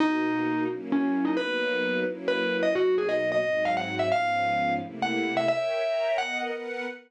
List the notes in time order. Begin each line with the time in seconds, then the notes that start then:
0.00 B2 A#3 D#4 F#4
0.69 F#3 A#3 C#4 E4
0.92 C#4
1.25 D#4
1.37 F#3 A#3 B3 D#4 B4
2.05 F#3 A#3 C#4 E4
2.28 B4
2.63 D#5
2.74 B2 F#3 A#3 D#4 F#4
2.98 G#4
3.09 D#5
3.32 D#5
3.42 G#2 F#3 C4 D#4
3.65 F5
3.77 F#5
3.99 E5
4.12 G#2 F3 B3 C#4 F5
4.80 C3 A3 A#3 E4
5.02 F#5
5.37 E5
5.48 A#4 C#5 E5 G5
5.83 A#4 C#5 G5 A#5
6.18 B3 A#4 D#5 F#5
6.51 B3 A#4 B4 F#5